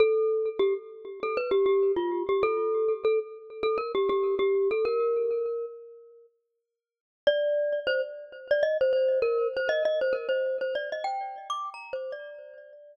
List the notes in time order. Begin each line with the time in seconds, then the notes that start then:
0.00 A4
0.59 G4
1.23 A4
1.37 B4
1.51 G4
1.66 G4
1.96 F4
2.29 G4
2.43 A4
3.05 A4
3.63 A4
3.78 A#4
3.95 G4
4.09 G4
4.39 G4
4.71 A4
4.85 A#4
7.27 D5
7.87 C5
8.51 D5
8.63 D#5
8.81 C5
8.93 C5
9.22 A#4
9.57 C5
9.69 D#5
9.85 D#5
10.01 C5
10.13 A#4
10.29 C5
10.61 C5
10.75 D5
10.92 D#5
11.04 G5
11.50 D6
11.74 A#5
11.93 C5
12.12 D5